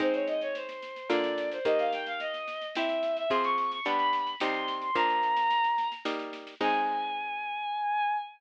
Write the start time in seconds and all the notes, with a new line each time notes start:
0.00 G#3 C4 D#4 C5, kick, snare
0.14 C#5, snare
0.27 D#5, snare
0.41 C#5, snare
0.55 C5, snare
0.69 snare
0.82 snare
0.96 snare
1.10 D3 A#3 F4 D5, snare
1.24 snare
1.38 snare
1.51 C5, snare
1.65 D#3 A#3 G4 D#5, kick, snare
1.79 F5, snare
1.92 G5, snare
2.06 F5, snare
2.20 D#5, snare
2.34 snare
2.48 snare
2.61 snare
2.75 C4 E4 G4 E5, snare
2.89 snare
3.03 snare
3.17 E5, snare
3.30 F3 C4 G#4 C6, kick, snare
3.44 C#6, snare
3.58 C#6, snare
3.72 C#6, snare
3.85 G3 B3 D4 B5, snare
3.99 snare
4.13 snare
4.27 snare
4.40 C3 G3 D#4 C6, snare
4.54 snare
4.68 snare
4.82 C6, snare
4.95 A#2 F3 D4 A#5, kick, snare
5.09 snare
5.23 snare
5.37 snare
5.50 snare
5.64 snare
5.78 snare
5.92 snare
6.05 G3 A#3 D#4, snare
6.19 snare
6.33 snare
6.47 snare
6.60 G#3 C4 D#4 G#5, kick, crash